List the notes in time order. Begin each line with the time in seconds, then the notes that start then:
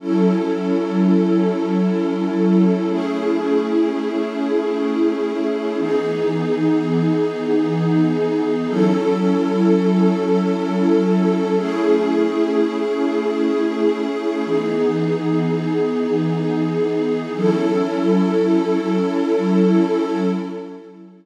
0.00 F#3 C#4 E4 A4
2.89 A3 C#4 E4 G#4
5.79 E3 B3 D#4 G#4
8.67 F#3 C#4 E4 A4
11.57 A3 C#4 E4 G#4
14.46 E3 B3 D#4 G#4
17.35 F#3 C#4 E4 A4